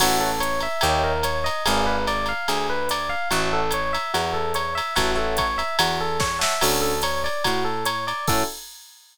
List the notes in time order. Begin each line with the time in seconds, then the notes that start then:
0.00 A1 F#4 C#5 E5 F#5 A5, kick, crash, ride
0.20 A4
0.40 C#5, hi-hat pedal, ride
0.60 E5, ride
0.81 D#2 G4 C#5 D#5 E5 G5, ride
1.04 A#4
1.23 C#5, hi-hat pedal, ride
1.44 D#5, ride
1.66 G#1 G#4 B4 D5 F5 G#5, ride
1.86 B4
2.07 D5, ride
2.26 F5, ride
2.48 D2 G#4, ride
2.70 B4
2.89 D5, hi-hat pedal, ride
3.09 F5
3.31 A1 F#4 C#5 E5 F#5 A5, ride
3.53 A4
3.71 C#5, hi-hat pedal, ride
3.93 E5, ride
4.14 E2 F#4, ride
4.34 A4
4.54 C#5, hi-hat pedal, ride
4.75 E5, ride
4.96 A1 F#4 C#5 E5 F#5 A5, kick, ride
5.15 A4 C#5 E5 F#5 A5
5.37 C#5, kick, hi-hat pedal, ride
5.58 E5, ride
5.79 E2 F#4, ride
6.01 A4
6.20 C#5, kick, snare
6.39 C#5 E5 F#5 A5, snare
6.43 E5
6.61 D2 C#4 D4 F#4 A4, crash, ride
6.82 A4
7.02 C#5, hi-hat pedal, ride
7.24 D5, ride
7.44 A2 F#4, kick, ride
7.65 A4
7.85 C#5, hi-hat pedal, ride
8.07 D5, ride
8.27 A2 C#4 E4 F#4 A4, kick, crash